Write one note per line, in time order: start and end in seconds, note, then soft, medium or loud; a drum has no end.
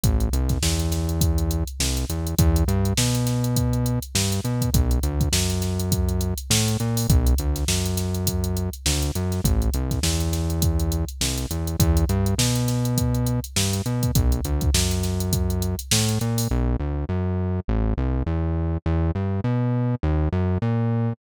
0.04 0.29 A1 medium
0.04 kick loud
0.04 closed hi-hat loud
0.20 closed hi-hat medium
0.33 0.59 C2 medium
0.33 closed hi-hat medium
0.49 kick medium
0.49 snare soft
0.49 closed hi-hat medium
0.62 1.64 E2 medium
0.62 snare loud
0.80 closed hi-hat medium
0.92 snare medium
0.92 closed hi-hat medium
1.09 closed hi-hat medium
1.21 kick medium
1.21 closed hi-hat loud
1.38 closed hi-hat medium
1.51 closed hi-hat medium
1.68 closed hi-hat medium
1.80 2.06 C2 medium
1.80 snare loud
1.97 closed hi-hat medium
2.09 2.35 E2 medium
2.09 closed hi-hat medium
2.27 closed hi-hat medium
2.39 2.64 E2 loud
2.39 kick loud
2.39 closed hi-hat loud
2.56 closed hi-hat medium
2.68 2.94 G2 loud
2.68 closed hi-hat medium
2.85 closed hi-hat medium
2.97 3.99 B2 medium
2.97 snare loud
3.15 snare soft
3.15 closed hi-hat medium
3.27 snare medium
3.27 closed hi-hat medium
3.44 closed hi-hat medium
3.56 kick medium
3.56 closed hi-hat loud
3.73 closed hi-hat medium
3.86 closed hi-hat medium
4.02 closed hi-hat medium
4.15 4.41 G2 medium
4.15 snare loud
4.32 closed hi-hat medium
4.44 4.70 B2 medium
4.44 closed hi-hat medium
4.61 kick medium
4.61 closed hi-hat medium
4.74 4.99 B1 medium
4.74 kick loud
4.74 closed hi-hat loud
4.91 closed hi-hat medium
5.03 5.29 D2 medium
5.03 closed hi-hat medium
5.21 kick medium
5.21 closed hi-hat medium
5.32 6.34 F#2 medium
5.32 snare loud
5.50 snare soft
5.50 closed hi-hat medium
5.62 snare medium
5.62 closed hi-hat medium
5.80 closed hi-hat medium
5.92 kick medium
5.92 closed hi-hat loud
6.09 closed hi-hat medium
6.21 closed hi-hat medium
6.38 closed hi-hat medium
6.50 6.77 A2 medium
6.50 snare loud
6.68 closed hi-hat medium
6.80 7.07 A#2 medium
6.80 closed hi-hat medium
6.97 open hi-hat medium
7.09 7.34 B1 loud
7.09 kick loud
7.09 closed hi-hat loud
7.27 closed hi-hat medium
7.38 7.65 D2 medium
7.38 closed hi-hat medium
7.56 snare soft
7.56 closed hi-hat medium
7.68 8.70 F#2 medium
7.68 snare loud
7.86 closed hi-hat medium
7.97 snare medium
7.97 closed hi-hat medium
8.15 closed hi-hat medium
8.27 kick medium
8.27 closed hi-hat loud
8.44 closed hi-hat medium
8.57 closed hi-hat medium
8.73 closed hi-hat medium
8.86 9.11 D2 medium
8.86 snare loud
9.02 closed hi-hat medium
9.15 9.41 F#2 medium
9.15 closed hi-hat medium
9.32 snare soft
9.32 closed hi-hat medium
9.44 9.70 A1 medium
9.44 kick loud
9.44 closed hi-hat loud
9.62 closed hi-hat medium
9.74 10.00 C2 medium
9.74 closed hi-hat medium
9.91 kick medium
9.91 snare soft
9.91 closed hi-hat medium
10.03 11.05 E2 medium
10.03 snare loud
10.20 closed hi-hat medium
10.33 snare medium
10.33 closed hi-hat medium
10.50 closed hi-hat medium
10.62 kick medium
10.62 closed hi-hat loud
10.80 closed hi-hat medium
10.92 closed hi-hat medium
11.09 closed hi-hat medium
11.21 11.47 C2 medium
11.21 snare loud
11.38 closed hi-hat medium
11.51 11.76 E2 medium
11.51 closed hi-hat medium
11.67 closed hi-hat medium
11.79 12.05 E2 loud
11.79 kick loud
11.79 closed hi-hat loud
11.97 closed hi-hat medium
12.09 12.35 G2 loud
12.09 closed hi-hat medium
12.26 closed hi-hat medium
12.38 13.40 B2 medium
12.38 snare loud
12.56 snare soft
12.56 closed hi-hat medium
12.68 snare medium
12.68 closed hi-hat medium
12.85 closed hi-hat medium
12.98 kick medium
12.98 closed hi-hat loud
13.15 closed hi-hat medium
13.27 closed hi-hat medium
13.44 closed hi-hat medium
13.56 13.82 G2 medium
13.56 snare loud
13.73 closed hi-hat medium
13.86 14.12 B2 medium
13.86 closed hi-hat medium
14.03 kick medium
14.03 closed hi-hat medium
14.15 14.41 B1 medium
14.15 kick loud
14.15 closed hi-hat loud
14.32 closed hi-hat medium
14.45 14.70 D2 medium
14.45 closed hi-hat medium
14.61 kick medium
14.61 closed hi-hat medium
14.74 15.76 F#2 medium
14.74 snare loud
14.91 snare soft
14.91 closed hi-hat medium
15.03 snare medium
15.03 closed hi-hat medium
15.20 closed hi-hat medium
15.33 kick medium
15.33 closed hi-hat loud
15.50 closed hi-hat medium
15.62 closed hi-hat medium
15.79 closed hi-hat medium
15.91 16.19 A2 medium
15.91 snare loud
16.09 closed hi-hat medium
16.21 16.48 A#2 medium
16.21 closed hi-hat medium
16.38 open hi-hat medium
16.51 16.76 B1 loud
16.80 17.05 D2 medium
17.09 17.60 F#2 medium
17.68 17.94 A1 loud
17.98 18.23 C2 loud
18.26 18.78 E2 medium
18.86 19.12 E2 loud
19.15 19.41 G2 medium
19.44 19.95 B2 medium
20.03 20.29 D#2 loud
20.32 20.58 F#2 loud
20.62 21.13 A#2 loud